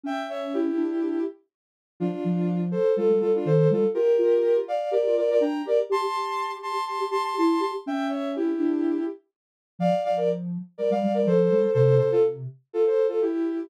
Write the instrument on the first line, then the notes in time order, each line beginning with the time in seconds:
ocarina
0.04 C#4 E5 G5
0.29 C#5 E5
0.54 E4 G4
0.76 D4
2.00 F3 D4 F4
2.24 F3
2.71 A4 C5
2.96 G3 F4 A4
3.09 G3
3.21 G3 F4 A4
3.35 D4 F4
3.45 D#3 A4 C5
3.70 G3 F4 A4
3.94 F4 G4 A#4
4.18 F4
4.68 D5 F5
4.91 G4 A#4 D5
5.05 F4
5.17 F4 A#4 D5
5.31 A#4 D5
5.40 D4 G5 A#5
5.65 G4 A#4 D5
5.90 G4 A5 C6
6.15 G4
6.63 A5 C6
6.87 G4 A5 C6
7.00 G4
7.11 G4 A5 C6
7.24 A5 C6
7.38 E4 A5 C6
7.60 G4 A5 C6
7.86 C#4 E5 G5
8.09 C#5 E5
8.36 E4 G4
8.58 D4
9.79 F3 D5 F5
10.04 F3 D5 F5
10.17 A#4 D5
10.78 G3 A#4 D5
10.90 G3 D5 F5
11.03 G3
11.14 A#4 D5
11.26 F3 A4 C5
11.51 G3
11.74 C3 A4 C5
11.98 C3 A4 C5
12.11 F4 A4
12.73 F4 A4
12.86 A4 C5
13.08 F4 A4
13.22 E4 G4